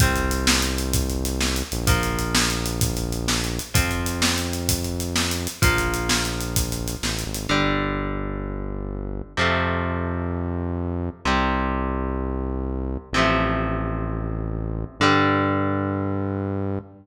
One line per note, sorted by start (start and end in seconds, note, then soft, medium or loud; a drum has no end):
0.00 1.63 C2 loud
0.00 1.84 G3 medium
0.00 1.84 C4 medium
0.00 kick loud
0.00 closed hi-hat loud
0.16 closed hi-hat medium
0.31 closed hi-hat medium
0.47 snare loud
0.62 closed hi-hat medium
0.78 closed hi-hat medium
0.93 kick loud
0.93 closed hi-hat loud
1.10 closed hi-hat medium
1.25 closed hi-hat loud
1.40 snare loud
1.56 closed hi-hat medium
1.72 3.60 A#1 loud
1.72 closed hi-hat medium
1.87 3.71 F3 medium
1.87 3.71 A#3 medium
1.87 kick loud
1.87 closed hi-hat loud
2.03 closed hi-hat medium
2.19 closed hi-hat medium
2.35 snare loud
2.50 closed hi-hat medium
2.66 closed hi-hat loud
2.81 kick loud
2.81 closed hi-hat loud
2.97 closed hi-hat medium
3.12 closed hi-hat medium
3.28 snare loud
3.44 closed hi-hat medium
3.59 closed hi-hat medium
3.74 5.48 F2 medium
3.74 5.58 F3 medium
3.74 5.58 C4 medium
3.74 kick loud
3.74 closed hi-hat loud
3.91 closed hi-hat medium
4.06 closed hi-hat medium
4.22 snare loud
4.38 closed hi-hat medium
4.53 closed hi-hat medium
4.69 kick loud
4.69 closed hi-hat loud
4.84 closed hi-hat medium
5.00 closed hi-hat medium
5.16 snare loud
5.31 closed hi-hat medium
5.47 closed hi-hat medium
5.62 6.96 A#1 medium
5.62 7.46 F3 medium
5.62 7.46 A#3 medium
5.62 kick loud
5.62 closed hi-hat loud
5.78 closed hi-hat medium
5.94 closed hi-hat medium
6.09 snare loud
6.25 closed hi-hat medium
6.41 closed hi-hat medium
6.56 kick loud
6.56 closed hi-hat loud
6.72 closed hi-hat medium
6.88 closed hi-hat medium
7.03 7.24 A1 medium
7.03 snare loud
7.19 closed hi-hat medium
7.26 7.48 G#1 medium
7.34 closed hi-hat medium
7.49 9.22 G1 medium
7.49 9.33 D3 medium
7.49 9.33 G3 medium
9.37 11.10 F2 loud
9.37 11.21 C3 medium
9.37 11.21 F3 medium
9.37 11.21 A3 medium
11.25 12.97 C2 medium
11.25 13.09 C3 medium
11.25 13.09 G3 medium
13.13 14.85 A1 medium
13.13 14.98 C3 medium
13.13 14.98 F3 medium
13.18 14.98 A3 medium
15.00 16.79 G2 loud
15.00 16.80 D3 loud
15.00 16.80 G3 medium